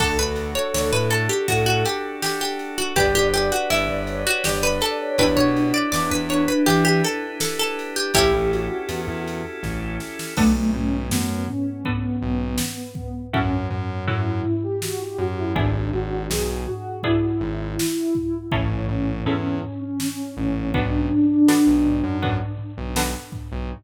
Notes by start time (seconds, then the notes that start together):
0.00 D2 D4 F#4 A4, kick, crash
0.19 D2 B4
0.36 ride
0.55 C#5
0.74 D2 C#5, snare
0.93 A2 B4
1.10 A4, ride
1.29 G4
1.48 A2 F#4, kick, ride
1.66 F#4
1.85 G4, ride
2.22 G4, snare
2.41 G4
2.59 ride
2.78 F#4
2.96 G1 D4 G4 B4 D5, kick, ride
3.15 G1 G4
3.33 G4 D5, ride
3.52 F#4
3.70 G1 E4, ride
3.89 G1
4.07 C#5, ride
4.27 F#4
4.44 G1 G4 D5, snare
4.63 B4
4.81 A4, ride
5.00 C#5
5.18 E2 D4 E4 G4 B4, kick, ride
5.37 B2 C#5
5.56 ride
5.74 D5
5.92 E2 D5, snare
6.11 E2 B4
6.29 C#5, ride
6.48 B4
6.66 E3 G4, kick, ride
6.85 G4
7.04 A4, ride
7.40 A4, snare
7.59 A4
7.79 ride
7.96 G4
8.14 A1 C#4 E4 G4 A4, kick, ride
8.33 A1
8.52 F#4, ride
8.89 E2, ride
9.07 E2
9.27 ride
9.63 A1, kick, snare
10.00 snare
10.19 snare
10.37 B1 A3 B3 D4 F#4 A4, kick, crash
10.73 B1 C#4, floor tom
11.11 F#2 B3, snare
11.48 C#4, floor tom
11.85 B3 D4 F#4 A4, kick, floor tom
12.21 B1, floor tom
12.58 snare
12.95 kick, floor tom
13.33 F#2 C#4 E4 F#4 A4, kick, floor tom
13.70 F#2, floor tom
14.07 F#2 C#4 E4 F#4 A4, floor tom
14.44 floor tom
14.63 G4
14.82 F#4, snare
15.00 G4
15.18 F#2 F#4, floor tom
15.37 E4
15.55 G#1 B3 D4 E4 G#4, kick, floor tom
15.92 G#1 F#4, floor tom
16.30 B1 G#4, snare
16.67 F#4, floor tom
17.03 B3 D4 E4 G#4, kick, floor tom
17.41 G#1, floor tom
17.79 snare
18.15 kick, floor tom
18.52 A1 C#4 E4 G#4 A4, kick, floor tom
18.70 C#4
18.88 A1 C#4, floor tom
19.26 E2 C#4 E4 G#4 A4, floor tom
19.63 C#4, floor tom
19.82 C#4
20.00 C#4, snare
20.37 A1 C#4, floor tom
20.74 B1 B3 D4 F#4 A4, kick, floor tom
21.13 floor tom
21.48 B3 D4 F#4 A4, snare
21.67 B1
21.86 floor tom
22.04 F#2
22.22 B3 D4 F#4 A4, kick, floor tom
22.58 floor tom
22.78 B1
22.96 B3 D4 F#4 A4, snare
23.32 kick, floor tom
23.52 B1